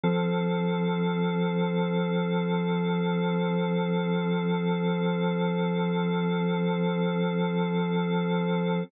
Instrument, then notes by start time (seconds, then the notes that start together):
drawbar organ
0.03 F3 C4 A4